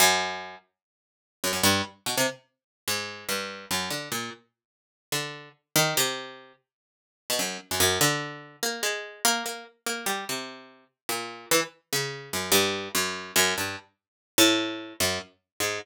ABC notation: X:1
M:7/8
L:1/16
Q:1/4=146
K:none
V:1 name="Harpsichord"
^F,,6 z8 | ^F,, F,, G,,2 z2 B,, C, z6 | ^G,,4 =G,,4 ^F,,2 D,2 ^A,,2 | z8 D,4 z2 |
^D,2 C,6 z6 | z B,, ^F,,2 z F,, F,,2 D,6 | ^A,2 ^G,4 A,2 A,2 z2 A,2 | G,2 C,6 z2 ^A,,4 |
E, z3 ^C,4 ^F,,2 G,,4 | ^F,,4 F,,2 G,,2 z6 | A,,6 ^F,,2 z4 ^G,,2 |]